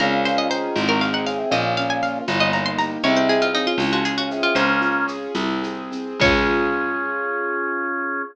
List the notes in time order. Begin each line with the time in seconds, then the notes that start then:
0.00 C#2 A#2 C#3 C#4 A#4, low conga, shaker
0.25 F4 C5, shaker
0.38 D#5
0.49 D#3 G#4 C5, shaker
0.76 G#1 C4, tambourine, high conga, shaker
0.89 F#3 A#4
1.01 G#4 F5, shaker
1.13 D#3 F#5
1.26 C#3 C4 F5, shaker
1.38 C3
1.50 A#1 A#2 C#3 A#3 D#5, low conga, shaker
1.77 C#4 F5, shaker
1.90 G#5
2.02 F4 F5, shaker
2.28 G1 C#3 A#3, tambourine, high conga, shaker
2.40 D#5
2.53 D#4 A#5, shaker
2.66 C6
2.78 G4 A#5, shaker
3.03 C2 G#2 C3 C4 C#5, low conga, shaker
3.17 C5
3.29 G#4, shaker
3.42 F4
3.54 C#3 C4 D#4, shaker
3.67 F4
3.78 C#2 C#4, tambourine, high conga, shaker
3.92 F3 F#4
4.05 F4 G#4, shaker
4.18 C#3 F#4
4.31 C3 G#4, shaker
4.43 C3 F4
4.55 C#2 A#3 C#4 C5, low conga, shaker
4.81 F4, shaker
5.08 G#4, shaker
5.35 C2 C4, tambourine, high conga, shaker
5.62 G#4, shaker
5.91 C4, shaker
6.20 C#2 C#4 F4 G#4 C#5, kick, crash